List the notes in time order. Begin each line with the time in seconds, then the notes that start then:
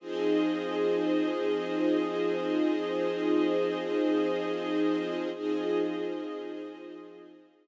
0.00 F3 C4 D#4 F4 G#4 C5 D#5
5.33 F3 C4 D#4 F4 G#4 C5 D#5